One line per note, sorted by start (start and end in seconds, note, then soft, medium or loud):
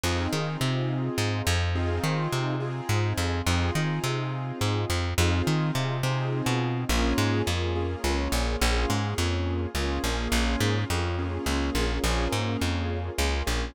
0.03 0.28 F2 loud
0.03 0.30 C4 medium
0.03 0.30 D#4 medium
0.03 0.30 F4 medium
0.03 0.30 G#4 medium
0.33 0.57 D#3 medium
0.33 1.64 C4 medium
0.33 1.64 D#4 medium
0.33 1.64 F4 medium
0.33 1.64 G#4 medium
0.61 1.10 C3 medium
1.18 1.42 G#2 loud
1.47 2.00 F2 loud
1.75 2.54 C4 medium
1.75 2.54 D#4 medium
1.75 2.54 F4 medium
1.75 2.54 G#4 medium
2.04 2.28 D#3 loud
2.33 2.81 C3 medium
2.60 3.39 C4 medium
2.60 3.39 D#4 medium
2.60 3.39 F4 medium
2.60 3.39 G#4 medium
2.89 3.13 G#2 medium
3.18 3.42 F2 loud
3.46 3.71 F2 loud
3.46 3.73 C4 medium
3.46 3.73 D#4 medium
3.46 3.73 F4 medium
3.46 3.73 G#4 medium
3.75 4.00 D#3 medium
3.75 5.07 C4 medium
3.75 5.07 D#4 medium
3.75 5.07 F4 medium
3.75 5.07 G#4 medium
4.04 4.52 C3 loud
4.61 4.85 G#2 medium
4.90 5.14 F2 loud
5.18 5.42 F2 loud
5.18 5.97 C4 medium
5.18 5.97 D#4 medium
5.18 5.97 F4 medium
5.18 5.97 G#4 medium
5.47 5.71 D#3 medium
5.75 6.02 C3 medium
6.03 6.42 C3 medium
6.03 6.83 C4 medium
6.03 6.83 D#4 medium
6.03 6.83 F4 medium
6.03 6.83 G#4 medium
6.46 6.85 B2 loud
6.89 7.14 A#1 loud
6.89 7.42 A#3 medium
6.89 7.42 C#4 medium
6.89 7.42 F4 medium
6.89 7.42 G#4 medium
7.18 7.42 G#2 loud
7.46 7.96 F2 medium
7.46 7.73 A#3 medium
7.46 7.73 C#4 medium
7.46 7.73 F4 medium
7.46 7.73 G#4 medium
7.75 8.02 A#3 medium
7.75 8.02 C#4 medium
7.75 8.02 F4 medium
7.75 8.02 G#4 medium
8.04 8.28 C#2 medium
8.04 8.31 A#3 medium
8.04 8.31 C#4 medium
8.04 8.31 F4 medium
8.04 8.31 G#4 medium
8.32 8.56 A#1 loud
8.32 8.58 A#3 medium
8.32 8.58 C#4 medium
8.32 8.58 F4 medium
8.32 8.58 G#4 medium
8.61 8.86 A#1 loud
8.61 8.88 A#3 medium
8.61 8.88 C#4 medium
8.61 8.88 F4 medium
8.61 8.88 G#4 medium
8.89 9.14 G#2 medium
8.89 9.68 A#3 medium
8.89 9.68 C#4 medium
8.89 9.68 F4 medium
8.89 9.68 G#4 medium
9.18 9.67 F2 loud
9.75 9.99 C#2 medium
9.75 10.01 A#3 medium
9.75 10.01 C#4 medium
9.75 10.01 F4 medium
9.75 10.01 G#4 medium
10.04 10.28 A#1 medium
10.04 10.30 A#3 medium
10.04 10.30 C#4 medium
10.04 10.30 F4 medium
10.04 10.30 G#4 medium
10.32 10.56 A#1 loud
10.32 10.85 A#3 medium
10.32 10.85 C#4 medium
10.32 10.85 F4 medium
10.32 10.85 G#4 medium
10.60 10.85 G#2 loud
10.90 11.39 F2 medium
10.90 11.16 A#3 medium
10.90 11.16 C#4 medium
10.90 11.16 F4 medium
10.90 11.16 G#4 medium
11.18 11.45 A#3 medium
11.18 11.45 C#4 medium
11.18 11.45 F4 medium
11.18 11.45 G#4 medium
11.46 11.70 C#2 medium
11.46 11.73 A#3 medium
11.46 11.73 C#4 medium
11.46 11.73 F4 medium
11.46 11.73 G#4 medium
11.75 11.99 A#1 medium
11.75 12.02 A#3 medium
11.75 12.02 C#4 medium
11.75 12.02 F4 medium
11.75 12.02 G#4 medium
12.04 12.28 A#1 loud
12.04 12.30 A#3 medium
12.04 12.30 C#4 medium
12.04 12.30 F4 medium
12.04 12.30 G#4 medium
12.32 12.57 G#2 medium
12.32 13.10 A#3 medium
12.32 13.10 C#4 medium
12.32 13.10 F4 medium
12.32 13.10 G#4 medium
12.61 13.10 F2 medium
13.18 13.43 C#2 loud
13.18 13.44 A#3 medium
13.18 13.44 C#4 medium
13.18 13.44 F4 medium
13.18 13.44 G#4 medium
13.47 13.71 A#1 medium
13.47 13.73 A#3 medium
13.47 13.73 C#4 medium
13.47 13.73 F4 medium
13.47 13.73 G#4 medium